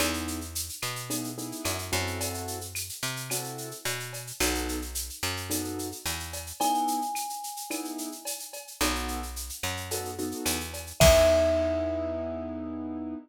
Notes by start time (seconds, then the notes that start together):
0.00 E2 B3 D#4 E4 G#4, cowbell, claves, shaker
0.14 shaker
0.28 shaker
0.41 shaker
0.55 shaker
0.69 shaker
0.82 B2, claves, shaker
0.96 shaker
1.10 B3 D#4 E4 G#4, cowbell, shaker
1.24 shaker
1.38 B3 D#4 E4 G#4, shaker
1.52 shaker
1.65 F#2, cowbell, claves, shaker
1.78 shaker
1.92 F#2 C4 E4 F#4 A4, cowbell, shaker
2.07 shaker
2.20 cowbell, shaker
2.34 shaker
2.47 shaker
2.61 shaker
2.75 claves, shaker
2.89 shaker
3.03 C3, shaker
3.16 shaker
3.30 C4 E4 F#4 A4, cowbell, claves, shaker
3.44 shaker
3.58 shaker
3.71 shaker
3.85 B2, cowbell, shaker
4.00 shaker
4.13 cowbell, shaker
4.27 shaker
4.40 B1 B3 D#4 F#4 A4, cowbell, claves, shaker
4.54 shaker
4.68 shaker
4.82 shaker
4.95 shaker
5.10 shaker
5.23 F#2, claves, shaker
5.37 shaker
5.50 B3 D#4 F#4 A4, cowbell, shaker
5.64 shaker
5.79 shaker
5.92 shaker
6.06 E2, cowbell, claves, shaker
6.20 shaker
6.33 cowbell, shaker
6.47 shaker
6.60 B3 D#4 E4 G#4 G#5, cowbell, shaker
6.74 shaker
6.88 shaker
7.02 shaker
7.15 claves, shaker
7.29 shaker
7.43 shaker
7.57 shaker
7.70 B3 D#4 E4 G#4, cowbell, claves, shaker
7.85 shaker
7.98 shaker
8.12 shaker
8.25 cowbell, shaker
8.39 shaker
8.53 cowbell, shaker
8.67 shaker
8.81 B1 B3 D#4 F#4 A4, cowbell, claves, shaker
8.95 shaker
9.08 shaker
9.23 shaker
9.36 shaker
9.49 shaker
9.63 F#2, claves, shaker
9.77 shaker
9.91 B3 D#4 F#4 A4, cowbell, shaker
10.05 shaker
10.18 B3 D#4 F#4 A4, shaker
10.31 shaker
10.46 E2, cowbell, claves, shaker
10.60 shaker
10.74 cowbell, shaker
10.87 shaker
11.00 E2 B3 D#4 E4 G#4 E5, kick, crash